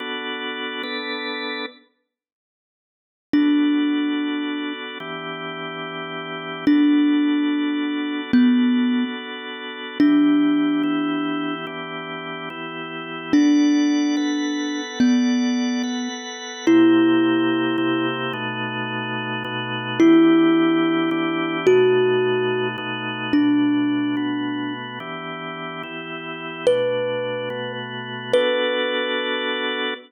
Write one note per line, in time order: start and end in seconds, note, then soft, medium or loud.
0.00 0.83 B3 medium
0.00 0.83 D4 medium
0.00 0.83 F#4 medium
0.00 0.83 A4 medium
0.83 1.66 B3 medium
0.83 1.66 D4 medium
0.83 1.66 A4 medium
0.83 1.66 B4 medium
3.33 4.98 B3 medium
3.33 4.73 D4 medium
3.33 4.98 D4 medium
3.33 4.98 F#4 medium
3.33 4.98 A4 medium
5.00 6.65 E3 medium
5.00 6.65 B3 medium
5.00 6.65 D4 medium
5.00 6.65 G4 medium
6.67 8.32 B3 medium
6.67 8.32 D4 medium
6.67 8.21 D4 medium
6.67 8.32 F#4 medium
6.67 8.32 A4 medium
8.33 9.04 B3 loud
8.33 9.98 B3 medium
8.33 9.98 D4 medium
8.33 9.98 F#4 medium
8.33 9.98 A4 medium
10.00 10.83 E3 medium
10.00 10.83 B3 medium
10.00 11.54 D4 loud
10.00 10.83 D4 medium
10.00 10.83 G4 medium
10.83 11.66 E3 medium
10.83 11.66 B3 medium
10.83 11.66 E4 medium
10.83 11.66 G4 medium
11.67 12.49 E3 medium
11.67 12.49 B3 medium
11.67 12.49 D4 medium
11.67 12.49 G4 medium
12.50 13.33 E3 medium
12.50 13.33 B3 medium
12.50 13.33 E4 medium
12.50 13.33 G4 medium
13.33 14.16 B3 medium
13.33 14.81 D4 loud
13.33 14.16 A4 medium
13.33 14.16 D5 medium
13.33 14.16 F#5 medium
14.17 14.99 B3 medium
14.17 14.99 A4 medium
14.17 14.99 B4 medium
14.17 14.99 F#5 medium
15.00 16.08 B3 medium
15.00 15.83 B3 medium
15.00 15.83 A4 medium
15.00 15.83 D5 medium
15.00 15.83 F#5 medium
15.83 16.66 B3 medium
15.83 16.66 A4 medium
15.83 16.66 B4 medium
15.83 16.66 F#5 medium
16.67 17.77 C3 medium
16.67 17.77 A#3 loud
16.67 17.77 E4 medium
16.67 18.07 E4 medium
16.67 17.77 G4 medium
17.78 18.33 C3 medium
17.78 18.33 A#3 medium
17.78 18.33 E4 medium
17.78 18.33 G4 loud
18.33 19.43 B2 medium
18.33 19.43 A3 loud
18.33 19.43 D#4 medium
18.33 19.43 F#4 medium
19.44 19.99 B2 loud
19.44 19.99 A3 medium
19.44 19.99 D#4 medium
19.44 19.99 F#4 medium
20.00 21.10 E3 loud
20.00 21.10 B3 medium
20.00 21.10 D4 medium
20.00 21.57 E4 loud
20.00 21.10 G4 medium
21.11 21.66 E3 medium
21.11 21.66 B3 medium
21.11 21.66 D4 loud
21.11 21.66 G4 medium
21.67 22.77 B2 medium
21.67 22.77 A3 loud
21.67 22.77 D#4 medium
21.67 22.68 F#4 loud
21.67 22.77 F#4 medium
22.78 23.33 B2 medium
22.78 23.33 A3 medium
22.78 23.33 D#4 loud
22.78 23.33 F#4 medium
23.33 24.16 B2 medium
23.33 24.16 A3 medium
23.33 24.73 D4 medium
23.33 24.16 D4 medium
23.33 24.16 F#4 medium
24.17 24.99 B2 medium
24.17 24.99 A3 medium
24.17 24.99 B3 medium
24.17 24.99 F#4 medium
25.00 25.83 E3 medium
25.00 25.83 B3 medium
25.00 25.83 D4 medium
25.00 25.83 G4 medium
25.83 26.66 E3 medium
25.83 26.66 B3 medium
25.83 26.66 E4 medium
25.83 26.66 G4 medium
26.67 27.49 B2 medium
26.67 27.49 A3 medium
26.67 27.49 D4 medium
26.67 27.49 F#4 medium
26.67 27.72 B4 loud
27.50 28.33 B2 medium
27.50 28.33 A3 medium
27.50 28.33 B3 medium
27.50 28.33 F#4 medium
28.33 29.94 B3 loud
28.33 29.94 D4 medium
28.33 29.94 F#4 loud
28.33 29.94 A4 loud
28.33 29.94 B4 loud